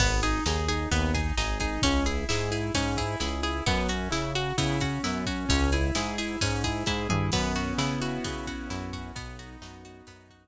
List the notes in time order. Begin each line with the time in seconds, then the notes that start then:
0.00 G#1 B3, kick, crash
0.23 D#4 G#4, ride
0.46 D#2 D#4 G#4, snare
0.68 D#4 G#4, ride
0.91 D#2 B3, kick, ride
1.14 D#4 G#4, kick, ride
1.37 G#1 D#4 G#4, snare
1.60 D#4 G#4, kick, ride
1.82 C#2 C#4, kick, ride
2.05 E4 G#4, ride
2.29 G#2 E4 G#4, snare
2.51 E4 G#4, ride
2.74 G#2 C#4, kick, ride
2.97 E4 G#4, kick, ride
3.20 C#2 E4 G#4, snare
3.43 E4 G#4, ride
3.66 F#2 B3, kick, ride
3.89 C#4 F#4, ride
4.11 C#3 E4, snare
4.35 F#4, ride
4.58 C#3 B3 E4, kick, ride
4.80 C#4 F#4, kick, ride
5.04 F#2 B3 E4, snare
5.26 C#4 F#4, kick, ride
5.49 C#2 C#4, kick, ride
5.72 E4 G#4, ride
5.95 G#2 E4 G#4, snare
6.18 E4 G#4, ride
6.41 G#2 C#4, kick, ride
6.64 E4 G#4, kick, ride
6.86 G#2 E4 G#4, kick, snare
7.09 G2 E4 G#4, mid tom
7.32 F#2 B3, kick, crash
7.55 C#4 F#4, ride
7.78 C#3 E4, snare
8.01 F#4, ride
8.24 C#3 B3, kick, ride
8.47 C#4 F#4, kick, ride
8.69 F#2 E4, snare
8.93 F#4, kick, ride
9.15 B1 B3, kick, ride
9.39 D#4 F#4, ride
9.61 F#2 D#4 F#4, snare
9.85 B3 F#4, ride
10.07 F#2 B3 D#4, kick, ride
10.29 F#4, kick, ride